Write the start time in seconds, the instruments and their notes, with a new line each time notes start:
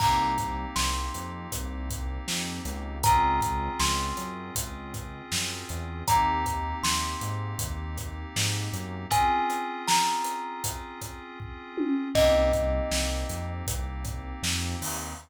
0.00 synth bass 1 C2, electric piano 2 A#3 C4 D#4 G4, kalimba A#5, kick, crash
0.38 kick, closed hi-hat
0.76 synth bass 1 C2, kalimba C6, snare
1.14 synth bass 1 F2, closed hi-hat
1.52 synth bass 1 C2, kick, closed hi-hat
1.90 kick, closed hi-hat
2.27 synth bass 1 F2, snare
2.65 synth bass 1 C#2, closed hi-hat
3.03 electric piano 2 C4 C#4 F4 G#4, kalimba A#5, kick, closed hi-hat
3.41 kick, closed hi-hat
3.79 synth bass 1 C#2, kalimba C6, snare
4.17 synth bass 1 F#2, closed hi-hat
4.55 synth bass 1 C#2, kick, closed hi-hat
4.94 kick, closed hi-hat
5.31 synth bass 1 F#2, snare
5.69 synth bass 1 E2, closed hi-hat
6.07 synth bass 1 D#2, electric piano 2 A#3 C4 D#4 G4, kalimba A#5, kick, closed hi-hat
6.46 kick, closed hi-hat
6.83 synth bass 1 D#2, kalimba C6, snare
7.21 synth bass 1 G#2, closed hi-hat
7.59 synth bass 1 D#2, kick, closed hi-hat
7.97 kick, closed hi-hat
8.36 synth bass 1 G#2, snare
8.73 synth bass 1 F#2, closed hi-hat
9.10 electric piano 2 C4 C#4 F4 G#4, kalimba G#5, kick, closed hi-hat
9.50 closed hi-hat
9.88 kalimba A#5, snare
10.25 closed hi-hat
10.64 kick, closed hi-hat
11.01 kick, closed hi-hat
11.40 kick
11.77 high tom
12.14 synth bass 1 C2, electric piano 2 A#3 C4 D#4 G4, kalimba D#5, kick, crash
12.53 kick, closed hi-hat
12.91 synth bass 1 C2, snare
13.29 synth bass 1 F2, closed hi-hat
13.67 synth bass 1 C2, kick, closed hi-hat
14.04 kick, closed hi-hat
14.42 synth bass 1 F2, snare
14.81 synth bass 1 D#2, open hi-hat